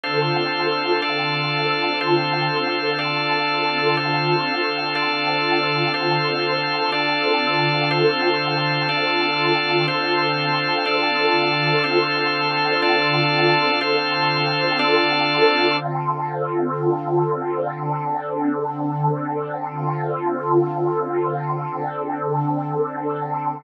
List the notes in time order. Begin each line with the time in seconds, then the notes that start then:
0.03 D3 C4 D4 F4 A4 C5 F5
1.02 D4 A4 D5 F5
2.00 D3 C4 D4 F4 A4 C5 F5
2.99 D4 A4 D5 F5
3.97 D3 C4 D4 F4 A4 C5 F5
4.95 D4 A4 D5 F5
5.94 D3 C4 D4 F4 A4 C5 F5
6.92 D4 A4 D5 F5
7.89 D3 C4 D4 F4 A4 C5 F5
8.89 D4 A4 D5 F5
9.88 D3 C4 D4 F4 A4 C5 F5
10.86 D4 A4 D5 F5
11.84 D3 C4 D4 F4 A4 C5 F5
12.82 D4 A4 D5 F5
13.80 D3 C4 D4 F4 A4 C5 F5
14.79 D4 A4 D5 F5
15.77 D3 C4 F4 A4
17.74 D3 C4 D4 A4
19.70 D3 C4 F4 A4
21.68 D3 C4 D4 A4